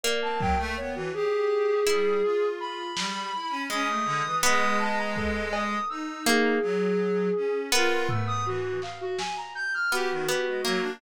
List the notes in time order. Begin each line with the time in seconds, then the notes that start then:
0.04 A#3 D5
0.21 C4 A5
0.39 F#3 G5, kick
0.58 A3
0.77 B3 C#5
0.95 E3 F#4
1.14 G4 G#4
1.87 G3 E4
2.24 F4
2.61 B5
2.97 G3, snare
3.35 E4
3.50 C#4
3.70 G#3 C#4 D#6
3.88 A3
4.05 D3
4.25 E3
4.43 G#3 B3 D#6, cowbell
4.79 A5
4.97 A#5
5.16 A4, kick
5.52 D#6, cowbell
5.89 D#4 E6
6.26 A#3 G#4
6.62 F#3
7.36 C#4
7.72 B3 F4 A#4
8.09 A3 E6, floor tom
8.27 D#6
8.46 E3 F#4
8.82 F5, clap
9.01 F#4
9.18 G#5, snare
9.37 A#5
9.55 G6
9.74 F6
9.91 B3 F#4 G4
10.11 D#3
10.27 B3 G4
10.47 G#3
10.65 F#3 A#3
10.81 D4